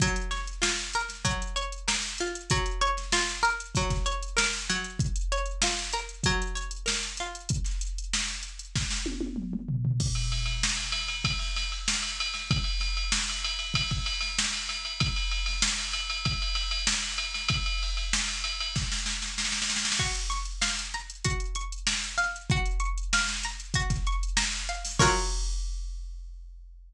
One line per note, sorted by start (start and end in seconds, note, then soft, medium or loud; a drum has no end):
0.00 1.24 F#3 medium
0.00 kick medium
0.00 closed hi-hat medium
0.16 closed hi-hat medium
0.31 1.55 C#5 medium
0.31 snare soft
0.31 closed hi-hat medium
0.47 closed hi-hat medium
0.62 2.20 F4 medium
0.62 snare medium
0.93 1.87 A#4 medium
0.93 closed hi-hat medium
1.09 snare soft
1.09 closed hi-hat medium
1.25 2.43 F#3 medium
1.25 kick medium
1.25 closed hi-hat medium
1.42 closed hi-hat medium
1.56 2.45 C#5 medium
1.56 closed hi-hat medium
1.72 closed hi-hat medium
1.88 2.47 A#4 medium
1.88 snare medium
2.03 closed hi-hat medium
2.18 2.50 F4 medium
2.18 closed hi-hat medium
2.35 closed hi-hat medium
2.50 3.76 F#3 medium
2.50 kick medium
2.50 closed hi-hat medium
2.66 closed hi-hat medium
2.81 4.05 C#5 medium
2.81 closed hi-hat medium
2.97 snare soft
2.97 closed hi-hat medium
3.12 4.91 F4 medium
3.12 snare medium
3.29 closed hi-hat medium
3.43 4.36 A#4 medium
3.43 closed hi-hat medium
3.60 closed hi-hat medium
3.75 4.69 F#3 medium
3.75 kick medium
3.75 closed hi-hat medium
3.90 kick medium
3.90 snare soft
3.90 closed hi-hat medium
4.06 4.95 C#5 medium
4.06 closed hi-hat medium
4.23 closed hi-hat medium
4.37 4.96 A#4 medium
4.37 snare loud
4.53 closed hi-hat medium
4.70 6.25 F#3 medium
4.70 closed hi-hat medium
4.84 closed hi-hat medium
4.99 kick medium
4.99 closed hi-hat medium
5.16 closed hi-hat medium
5.32 6.55 C#5 medium
5.32 closed hi-hat medium
5.46 closed hi-hat medium
5.62 7.20 F4 medium
5.62 snare loud
5.79 closed hi-hat medium
5.93 6.85 A#4 medium
5.93 closed hi-hat medium
6.09 closed hi-hat medium
6.24 7.45 F#3 medium
6.24 kick medium
6.24 closed hi-hat medium
6.42 closed hi-hat medium
6.55 7.44 C#5 medium
6.55 closed hi-hat medium
6.71 closed hi-hat medium
6.86 7.45 A#4 medium
6.86 snare medium
7.03 closed hi-hat medium
7.17 7.50 F4 medium
7.17 closed hi-hat medium
7.35 closed hi-hat medium
7.49 kick medium
7.49 closed hi-hat medium
7.64 snare soft
7.64 closed hi-hat medium
7.81 closed hi-hat medium
7.98 closed hi-hat medium
8.13 snare medium
8.28 closed hi-hat medium
8.43 closed hi-hat medium
8.59 closed hi-hat medium
8.76 kick medium
8.76 snare medium
8.90 snare medium
9.06 high tom medium
9.21 high tom medium
9.36 mid tom medium
9.53 mid tom medium
9.68 floor tom medium
9.85 floor tom medium
10.00 kick medium
10.00 crash medium
10.15 ride medium
10.32 ride medium
10.46 ride medium
10.63 snare medium
10.77 ride medium
10.92 snare soft
10.92 ride medium
11.08 ride medium
11.24 kick medium
11.24 ride medium
11.39 snare soft
11.39 ride medium
11.56 snare soft
11.56 ride medium
11.72 ride medium
11.88 snare medium
12.03 ride medium
12.20 ride medium
12.34 snare soft
12.34 ride medium
12.51 kick loud
12.51 ride medium
12.64 ride medium
12.80 snare soft
12.80 ride medium
12.97 ride medium
13.12 snare loud
13.29 ride medium
13.44 ride medium
13.59 ride medium
13.74 kick medium
13.74 ride loud
13.91 kick medium
13.91 ride medium
14.06 ride medium
14.21 snare soft
14.21 ride medium
14.39 snare loud
14.53 ride medium
14.69 snare soft
14.69 ride medium
14.85 ride medium
15.00 kick loud
15.00 ride medium
15.16 ride medium
15.32 ride medium
15.46 snare soft
15.46 ride medium
15.62 snare loud
15.79 ride medium
15.93 ride medium
16.10 ride medium
16.25 kick medium
16.25 ride medium
16.42 ride medium
16.55 ride medium
16.71 ride medium
16.87 snare loud
17.02 ride medium
17.18 ride medium
17.34 snare soft
17.34 ride medium
17.49 kick medium
17.49 ride loud
17.66 ride medium
17.83 ride medium
17.97 ride medium
18.13 snare loud
18.28 ride medium
18.44 ride medium
18.60 ride medium
18.76 kick medium
18.76 snare medium
18.92 snare medium
19.06 snare medium
19.22 snare medium
19.38 snare medium
19.45 snare medium
19.52 snare medium
19.62 snare medium
19.70 snare medium
19.76 snare medium
19.85 snare medium
19.92 snare medium
19.99 21.24 F#4 medium
19.99 kick medium
19.99 crash medium
20.15 closed hi-hat medium
20.30 21.55 C#6 medium
20.30 snare soft
20.30 closed hi-hat medium
20.45 closed hi-hat medium
20.61 22.17 F5 medium
20.61 snare medium
20.79 closed hi-hat medium
20.94 21.87 A#5 medium
20.94 closed hi-hat medium
21.10 closed hi-hat medium
21.24 22.43 F#4 medium
21.24 kick medium
21.24 closed hi-hat medium
21.40 closed hi-hat medium
21.55 22.45 C#6 medium
21.55 closed hi-hat medium
21.72 closed hi-hat medium
21.87 22.47 A#5 medium
21.87 snare medium
22.04 closed hi-hat medium
22.18 22.47 F5 medium
22.18 snare soft
22.18 closed hi-hat medium
22.36 closed hi-hat medium
22.50 23.75 F#4 medium
22.50 kick medium
22.50 closed hi-hat medium
22.65 closed hi-hat medium
22.80 24.07 C#6 medium
22.80 closed hi-hat medium
22.98 closed hi-hat medium
23.13 24.68 F5 medium
23.13 snare medium
23.28 snare medium
23.43 24.36 A#5 medium
23.43 snare soft
23.43 closed hi-hat medium
23.60 closed hi-hat medium
23.74 24.94 F#4 medium
23.74 kick medium
23.74 closed hi-hat medium
23.90 kick medium
23.90 snare soft
23.90 closed hi-hat medium
24.07 24.96 C#6 medium
24.07 closed hi-hat medium
24.23 closed hi-hat medium
24.37 24.96 A#5 medium
24.37 snare loud
24.53 closed hi-hat medium
24.69 24.99 F5 medium
24.69 closed hi-hat medium
24.85 snare soft
24.85 open hi-hat medium
24.99 26.93 F#3 loud
24.99 26.93 F4 medium
24.99 26.93 A#4 medium
24.99 26.93 C#5 medium
24.99 kick loud
24.99 crash loud